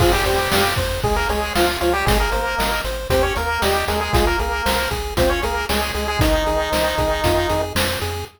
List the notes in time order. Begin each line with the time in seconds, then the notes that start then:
0.00 F2 F3 F4 G#4, kick, crash
0.13 G3 G4
0.25 F2 G3 G4 C5, closed hi-hat
0.52 F2 F5, snare
0.76 F2 C5, kick, closed hi-hat
1.03 C#2 G#3 G#4, kick
1.16 A#3 A#4
1.29 C#2 G#3 G#4 C#5, closed hi-hat
1.55 C#2 F3 F4 F5, snare
1.81 C#2 F3 F4 C#5, closed hi-hat
1.93 G3 G4
2.06 G#1 G#3 G#4, kick, closed hi-hat
2.20 A#3 A#4
2.31 G#1 A#3 A#4 C5, closed hi-hat
2.58 G#1 D#5, snare
2.84 G#1 C5, closed hi-hat
3.10 D#2 C4 G4 C5, kick, closed hi-hat
3.23 C#4 C#5
3.36 D#2 A#3 A#4, closed hi-hat
3.62 D#2 G3 G4 D#5, snare
3.88 D#2 G#3 G#4 A#4, closed hi-hat
4.01 G#3 G#4
4.13 C2 G#3 F4 G#4, kick, closed hi-hat
4.27 A#3 A#4
4.39 C2 A#3 G#4 A#4, closed hi-hat
4.66 C2 C5, snare
4.91 C2 G#4, kick, closed hi-hat
5.17 C#2 C4 F4 C5, kick, closed hi-hat
5.30 C#4 C#5
5.42 C#2 A#3 G#4 A#4, closed hi-hat
5.69 C#2 G#3 G#4 C#5, snare
5.94 C#2 G#3 G#4, closed hi-hat
6.08 G#3 G#4
6.19 C2 D#3 D#4, kick, closed hi-hat
6.46 C2 G#4, closed hi-hat
6.72 C2 C5, snare
6.98 C2 G#4, kick, closed hi-hat
7.24 F2 F4, kick, closed hi-hat
7.49 F2 G#4, closed hi-hat
7.75 F2 C5, snare
8.01 F2 G#4, closed hi-hat